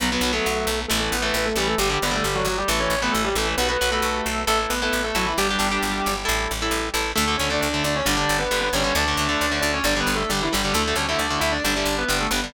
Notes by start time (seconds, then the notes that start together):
0.00 B1 F#3 B3 B4
0.12 F#3 B3 B4
0.21 B1 F#3 B3
0.33 F#3 A3 B3 A4
0.46 B1
0.67 B1
0.88 A1 E3 A3 A4
1.12 A1 B3 B4
1.22 E3 A3 B3 B4
1.34 A1 B3 B4
1.45 A3 A4
1.56 A1 E3 G3 A3 G4
1.67 A3 A4
1.78 G1 D3 G3 G4
1.89 D3 G3 G4
2.02 G1 D3 G3 B3 B4
2.11 D3 G3 A3 A4
2.23 G1 G3 G4
2.35 F#3 F#4
2.45 G1 F#3 F#4
2.58 G3 G4
2.68 A1 E3 A3 A4
2.80 C#4 C#5
2.90 A1
3.02 E3 A3 B3 B4
3.12 A1 A3 A4
3.25 G3 G4
3.35 A1 E3 A3 A4
3.57 B1 B3 F#4 B4
3.69 B3 F#4 B4
3.81 B1 F#4 B4
3.91 A3 F#4 A4 B4
4.02 B1
4.26 B1
4.47 A1 A3 E4 A4
4.70 A1 B3 B4
4.82 B3 E4 A4 B4
4.91 A1 B3 B4
5.04 A3 A4
5.15 A1 F#3 E4 F#4 A4
5.26 E3 E4
5.38 G1 G3 D4 G4
5.50 D4 G4
5.59 G1 D4 G4
5.72 D4 G4
5.83 G1
6.06 G1
6.25 A1 E4 A4
6.51 A1
6.62 E4 A4
6.71 A1
6.94 A1 E4 A4
7.16 D2 D3 A3 A4
7.28 D3 A3
7.37 D2 D3 A3 C#4 C#5
7.50 D3 A3 D4 D5
7.61 D2 D4 D5
7.74 D3 A3
7.84 D2 D4 D5
7.96 C#4 C#5
8.05 G1 D3 G3 D4 D5
8.17 D3 G3
8.29 G1
8.39 B3 B4
8.51 G1 D3 G3
8.61 B3 B4
8.73 G1 D3 G3 C#4 C#5
8.84 D3 G3
8.95 D2 D3 A3 D4 D5
9.08 D3 A3
9.17 D2 D3 A3
9.29 D3 A3
9.41 D2
9.52 D3 A3
9.61 D2 D4 D5
9.73 C#4 C#5
9.84 G1 D3 G3 D4 D5
9.96 D3 G3
10.00 B3 B4
10.07 G1
10.15 A3 A4
10.29 G1 D3 G3 G4
10.43 E3 E4
10.52 G1 D3 G3 G4
10.64 D3 G3
10.74 D2 D3 A3 A4
10.88 D3 A3
10.96 D2 D3 A3 C#4 C#5
11.09 D3 A3 E4 E5
11.18 D2 D4 D5
11.30 D3 A3
11.40 D2 E4 E5
11.52 D4 D5
11.64 G1 D3 G3 D4 D5
11.76 D3 G3
11.85 G1
11.98 B3 B4
12.08 G1 D3 G3
12.21 A3 A4
12.31 G1 D3 G3 B3 B4
12.44 D3 G3